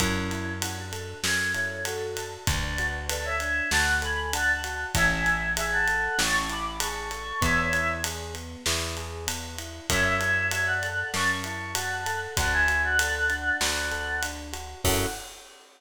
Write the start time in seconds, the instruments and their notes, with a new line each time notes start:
0.00 electric bass (finger) F#2, choir aahs C#4 E4, electric piano 1 C#4, kick, ride
0.31 electric piano 1 E4, ride
0.62 choir aahs C#4 E4, electric piano 1 F#4, ride
0.77 choir aahs D4 F#4
0.92 electric piano 1 A4, ride
1.23 electric bass (finger) F#2, electric piano 1 C#4, choir aahs A4 C#5, snare
1.54 electric piano 1 E4, choir aahs A4 C#5, ride
1.85 choir aahs F#4 A4, electric piano 1 F#4, ride
2.17 electric piano 1 A4, ride
2.47 electric bass (finger) D2, electric piano 1 D4, choir aahs B4 D5, kick, ride
2.78 electric piano 1 F#4, ride
3.09 electric piano 1 A4, choir aahs B4 D5, ride
3.25 choir aahs C#5 E5
3.40 electric piano 1 D4, ride
3.71 electric bass (finger) D2, electric piano 1 F#4, choir aahs F#5 A5, snare
4.02 electric piano 1 A4, choir aahs G#5 B5, ride
4.33 electric piano 1 D4, choir aahs F#5 A5, ride
4.64 electric piano 1 F#4, ride
4.95 electric bass (finger) A1, electric piano 1 C#4, choir aahs E5 G#5, kick, ride
5.26 electric piano 1 E4, ride
5.56 electric piano 1 G#4, choir aahs E5 G#5, ride
5.72 choir aahs F#5 A5
5.88 electric piano 1 A4, ride
6.18 electric bass (finger) A1, electric piano 1 C#4, choir aahs A5 C#6, snare
6.49 electric piano 1 E4, choir aahs B5 D6, ride
6.80 electric piano 1 G#4, choir aahs A5 C#6, ride
7.11 electric piano 1 A4, ride
7.41 electric bass (finger) E2, electric piano 1 B3, choir aahs C#5 E5, kick, ride
7.73 electric piano 1 E4, ride
8.04 electric piano 1 G#4, ride
8.34 electric piano 1 B3, ride
8.66 electric bass (finger) E2, electric piano 1 E4, snare
8.97 electric piano 1 G#4, ride
9.27 electric piano 1 B3, ride
9.58 electric piano 1 E4, ride
9.90 electric bass (finger) F#2, electric piano 1 C#4, choir aahs C#5 E5, kick, ride
10.21 electric piano 1 E4, ride
10.51 electric piano 1 F#4, choir aahs C#5 E5, ride
10.67 choir aahs D5 F#5
10.83 electric piano 1 A4, ride
11.13 electric bass (finger) F#2, electric piano 1 C#4, choir aahs A5 C#6, snare
11.44 electric piano 1 E4, choir aahs A5 C#6, ride
11.75 electric piano 1 F#4, choir aahs F#5 A5, ride
12.06 electric piano 1 A4, ride
12.37 electric bass (finger) D2, electric piano 1 D4, choir aahs F#5 A5, kick, ride
12.53 choir aahs E5 G#5
12.68 electric piano 1 F#4, ride
12.84 choir aahs D5 F#5
12.99 electric piano 1 A4, ride
13.30 electric piano 1 D4, ride
13.61 electric bass (finger) D2, electric piano 1 F#4, choir aahs D5 F#5, snare
13.91 electric piano 1 A4, ride
14.23 electric piano 1 D4, ride
14.53 electric piano 1 F#4, ride
14.84 electric bass (finger) F#2, electric piano 1 C#4 E4 F#4 A4, choir aahs F#5, kick, crash